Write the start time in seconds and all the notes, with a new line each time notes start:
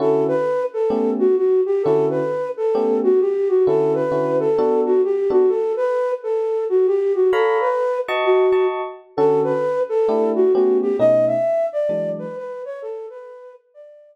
0.00 D3 C#4 E4 F#4 A4
0.28 B4
0.74 A4
0.90 A3 B3 C#4 G4
1.19 F#4
1.37 F#4
1.66 G4
1.83 D3 C#4 E4 F#4 A4
2.10 B4
2.57 A4
2.75 A3 B3 C#4 G4
3.04 F#4
3.21 G4
3.49 F#4
3.66 D3 C#4 E4 F#4 A4
3.95 B4
4.12 D3 C#4 E4 F#4
4.40 A4
4.58 B3 D4 F#4 A4
4.86 F#4
5.04 G4
5.30 B3 D4 F#4 A4
5.49 A4
5.77 B4
6.23 A4
6.69 F#4
6.87 G4
7.15 F#4
7.32 A4 C#5 F5 A#5 B5
7.61 B4
8.08 F#4 D#5 A5 C#6
8.25 F#4
8.52 F#4 D#5 A5 C#6
9.17 D3 C#4 F#4 A4
9.44 B4
9.89 A4
10.08 A3 D4 E4 G4
10.35 F#4
10.54 A3 B3 C#4 F#4 G4
10.82 G4
10.99 B2 A3 C#4 D#4 D#5
11.27 E5
11.73 D5
11.89 E3 F#3 G#3 D4
12.19 B4
12.37 B4
12.65 C#5
12.82 A4
13.10 B4
13.74 D5